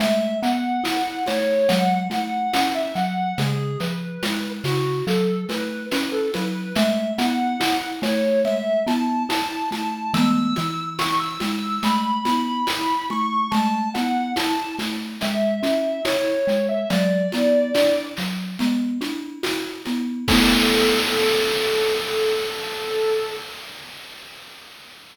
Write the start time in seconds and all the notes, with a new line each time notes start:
0.00 A3 E5, low conga, shaker
0.42 B3 F#5, shaker
0.84 E4, tambourine, high conga, shaker
1.26 A3 C#5, snare, high conga, shaker
1.68 F#3 F#5, low conga, shaker
2.10 A3 F#5, high conga, shaker
2.53 C#4 F#5, tambourine, high conga, shaker
2.75 E5
2.95 F#3 F#5, shaker
3.38 C#3 G#4, low conga, shaker
3.80 F3 B4, shaker
4.23 G#3, tambourine, high conga, shaker
4.64 C#3 F#4, snare, high conga, shaker
5.07 F#3 A4, shaker
5.49 A3 B4, snare, high conga, shaker
5.91 C#4 B4, tambourine, high conga, shaker
6.12 A4
6.34 F#3 B4, snare, high conga, shaker
6.75 A3 E5, low conga, shaker
7.18 B3 F#5, high conga, shaker
7.60 E4, tambourine, high conga, shaker
8.02 A3 C#5, snare, high conga, shaker
8.45 E5, low conga, shaker
8.87 B3 A5, high conga, shaker
9.29 E4 A5, tambourine, high conga, shaker
9.50 A5
9.71 A3 A5, high conga, shaker
10.14 E3 A3 B3 E6, low conga, shaker
10.56 E3, high conga, shaker
10.99 C#6, tambourine, high conga, shaker
11.20 E6
11.40 G#3 E6, snare, high conga, shaker
11.83 A3 B5, low conga, shaker
12.25 B3, high conga, shaker
12.67 E4, tambourine, high conga, shaker
13.10 A3 C#6, high conga
13.51 A3 A5, low conga, shaker
13.94 B3 F#5, high conga, shaker
14.36 E4 A5, tambourine, high conga, shaker
14.79 A3, snare, high conga, shaker
15.21 G#3 E5, low conga, shaker
15.63 C#4, high conga, shaker
16.05 E4 C#5, tambourine, high conga, shaker
16.47 G#3, shaker
16.69 E5
16.90 F#3 D5, low conga, shaker
17.32 B3, high conga, shaker
17.74 D4, tambourine, high conga, shaker
18.17 F#3, snare, shaker
18.59 B3, low conga, shaker
19.01 D4, high conga, shaker
19.43 F#4, tambourine, high conga, shaker
19.86 B3, high conga, shaker
20.28 A3 B3 A4, kick, crash
20.32 E4